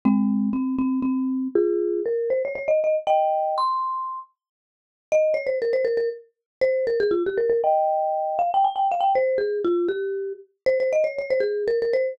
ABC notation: X:1
M:6/8
L:1/16
Q:3/8=79
K:Ab
V:1 name="Marimba"
[A,C]4 C2 C2 C4 | [FA]4 B2 c d d e e z | [eg]4 c'6 z2 | [K:Fm] z4 e2 d c B c B B |
z4 c2 B A F G B B | [eg]6 f g a g f g | c2 A2 F2 G4 z2 | c c e d d c A2 B B c2 |]